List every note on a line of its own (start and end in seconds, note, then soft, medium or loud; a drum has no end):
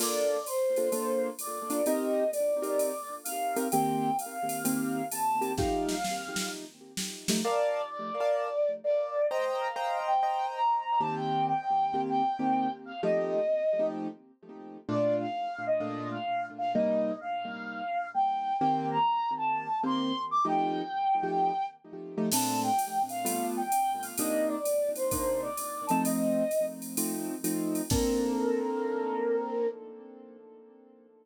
0.00 0.37 A#3 loud
0.00 0.37 D4 medium
0.00 0.37 F4 loud
0.00 0.37 A4 loud
0.00 0.45 D5 medium
0.00 crash loud
0.00 ride medium
0.46 1.28 C5 medium
0.46 hi-hat pedal medium
0.46 ride medium
0.76 0.89 A#3 medium
0.76 0.89 D4 medium
0.76 0.89 F4 medium
0.76 0.89 A4 medium
0.76 ride medium
0.92 1.29 A#3 medium
0.92 1.29 D4 medium
0.92 1.29 F4 medium
0.92 1.29 A4 medium
0.92 ride medium
1.39 1.85 D5 medium
1.39 hi-hat pedal medium
1.39 ride medium
1.70 1.81 A#3 medium
1.70 1.81 D4 medium
1.70 1.81 F4 medium
1.70 1.81 A4 medium
1.70 ride medium
1.86 2.24 C4 medium
1.86 2.24 D#4 loud
1.86 2.24 G4 loud
1.86 2.24 A#4 loud
1.86 2.30 D#5 medium
1.86 ride medium
2.32 3.14 D5 medium
2.32 hi-hat pedal medium
2.32 ride medium
2.62 2.91 C4 medium
2.62 2.91 D#4 medium
2.62 2.91 G4 medium
2.62 2.91 A#4 medium
2.62 ride medium
2.79 ride medium
3.24 3.68 F5 medium
3.24 hi-hat pedal medium
3.24 ride medium
3.56 3.68 C4 medium
3.56 3.68 D#4 medium
3.56 3.68 G4 medium
3.56 3.68 A#4 medium
3.56 ride medium
3.72 4.10 D#3 medium
3.72 4.10 A#3 loud
3.72 4.10 C4 loud
3.72 4.10 G4 loud
3.72 4.16 G5 medium
3.72 ride medium
4.19 5.05 F5 medium
4.19 hi-hat pedal medium
4.19 ride medium
4.49 ride medium
4.65 5.02 D#3 medium
4.65 5.02 A#3 medium
4.65 5.02 C4 medium
4.65 5.02 G4 medium
4.65 ride loud
5.12 5.52 A5 medium
5.12 hi-hat pedal medium
5.12 ride medium
5.41 5.52 D#3 medium
5.41 5.52 A#3 medium
5.41 5.52 C4 medium
5.41 5.52 G4 medium
5.41 ride medium
5.58 5.95 F3 medium
5.58 5.95 A3 loud
5.58 5.95 D#4 loud
5.58 5.95 G4 loud
5.58 6.48 F5 medium
5.58 kick medium
5.58 snare medium
5.89 snare medium
6.04 snare medium
6.36 snare medium
6.97 snare medium
7.28 7.41 F3 medium
7.28 7.41 A3 medium
7.28 7.41 D#4 medium
7.28 7.41 G4 medium
7.28 snare loud
7.44 7.81 A#4 loud
7.44 7.88 D5 loud
7.44 7.81 D5 loud
7.44 7.81 F5 loud
7.44 7.81 A5 loud
7.90 8.70 D5 loud
8.20 8.49 A#4 medium
8.20 8.49 D5 medium
8.20 8.49 F5 medium
8.20 8.49 A5 medium
8.84 9.26 D5 loud
9.30 9.68 C5 loud
9.30 9.59 D#5 loud
9.30 9.68 D#5 loud
9.30 9.68 G5 loud
9.30 9.68 A#5 loud
9.60 9.99 F5 medium
9.76 10.13 C5 medium
9.76 10.13 D#5 medium
9.76 10.13 G5 medium
9.76 10.13 A#5 medium
10.07 10.46 G5 medium
10.23 10.60 C5 medium
10.23 10.60 D#5 medium
10.23 10.60 G5 medium
10.23 10.60 A#5 medium
10.55 10.99 A#5 medium
11.00 11.53 D#3 loud
11.00 11.53 A#3 medium
11.00 11.53 C4 loud
11.00 11.53 G4 loud
11.00 11.14 A5 medium
11.16 11.45 G5 medium
11.47 12.00 G5 medium
11.94 12.22 D#3 medium
11.94 12.22 A#3 medium
11.94 12.22 C4 medium
11.94 12.22 G4 medium
12.09 12.72 G5 medium
12.39 12.67 D#3 loud
12.39 12.67 A#3 medium
12.39 12.67 C4 medium
12.39 12.67 G4 medium
12.85 13.01 F5 medium
13.03 13.40 F3 loud
13.03 13.40 A3 loud
13.03 13.40 D#4 loud
13.03 13.40 G4 loud
13.03 13.88 D#5 medium
13.79 14.07 F3 medium
13.79 14.07 A3 medium
13.79 14.07 D#4 medium
13.79 14.07 G4 medium
14.89 15.26 A#2 loud
14.89 15.26 A3 medium
14.89 15.26 D4 loud
14.89 15.26 F4 loud
14.89 15.16 D5 loud
15.20 15.65 F5 medium
15.67 16.08 D#5 medium
15.80 16.17 A#2 medium
15.80 16.17 A3 medium
15.80 16.17 D4 medium
15.80 16.17 F4 loud
16.11 16.46 F5 medium
16.58 16.72 F5 medium
16.75 17.12 C3 medium
16.75 17.12 G3 loud
16.75 17.12 A#3 loud
16.75 17.12 D#4 loud
16.75 17.16 D#5 medium
17.20 18.09 F5 medium
18.14 18.57 G5 medium
18.59 18.98 D#3 loud
18.59 18.98 A#3 loud
18.59 18.98 C4 loud
18.59 18.98 G4 loud
18.59 18.87 G5 medium
18.91 19.31 A#5 medium
19.37 19.78 A5 medium
19.83 20.12 D#3 medium
19.83 20.12 A#3 loud
19.83 20.12 C4 medium
19.83 20.12 G4 medium
19.83 20.21 C6 medium
20.31 20.45 D6 medium
20.45 20.82 F3 loud
20.45 20.82 A3 loud
20.45 20.82 D#4 loud
20.45 20.82 G4 loud
20.45 21.66 G5 loud
21.23 21.51 F3 medium
21.23 21.51 A3 medium
21.23 21.51 D#4 medium
21.23 21.51 G4 medium
22.18 22.29 F3 medium
22.18 22.29 A3 medium
22.18 22.29 D#4 medium
22.18 22.29 G4 medium
22.32 22.69 A#2 loud
22.32 22.69 A3 loud
22.32 22.69 C4 loud
22.32 22.69 D4 loud
22.32 22.60 A5 medium
22.32 crash loud
22.32 ride loud
22.63 23.02 G5 medium
22.79 hi-hat pedal loud
22.79 ride medium
23.09 23.46 F5 medium
23.09 ride medium
23.25 23.62 G3 loud
23.25 23.62 A3 loud
23.25 23.62 B3 loud
23.25 23.62 F4 medium
23.25 ride loud
23.57 24.02 G5 medium
23.72 hi-hat pedal medium
23.72 ride medium
24.02 24.15 F5 medium
24.02 ride medium
24.18 24.56 C3 loud
24.18 24.56 A#3 loud
24.18 24.56 D4 loud
24.18 24.56 D#4 loud
24.18 24.48 D#5 medium
24.18 ride loud
24.48 24.89 D5 medium
24.65 hi-hat pedal medium
24.65 ride medium
24.96 25.40 C5 medium
24.96 ride medium
25.11 25.49 C3 medium
25.11 25.49 A#3 medium
25.11 25.49 D4 medium
25.11 25.49 D#4 medium
25.11 kick medium
25.11 ride loud
25.42 25.85 D5 medium
25.57 hi-hat pedal medium
25.57 ride medium
25.87 26.43 F3 medium
25.87 26.43 A3 loud
25.87 26.43 C4 loud
25.87 26.43 D#4 loud
25.87 26.02 A5 medium
25.87 ride medium
26.05 26.65 D#5 medium
26.05 ride loud
26.51 hi-hat pedal medium
26.51 ride medium
26.82 ride medium
26.97 27.35 F3 medium
26.97 27.35 A3 medium
26.97 27.35 C4 medium
26.97 27.35 D#4 medium
26.97 ride loud
27.44 27.81 F3 medium
27.44 27.81 A3 medium
27.44 27.81 C4 medium
27.44 27.81 D#4 medium
27.44 hi-hat pedal medium
27.44 ride medium
27.75 ride medium
27.90 29.67 A#3 loud
27.90 29.67 C4 loud
27.90 29.67 D4 medium
27.90 29.67 A4 loud
27.90 29.67 A#4 loud
27.90 kick loud
27.90 crash loud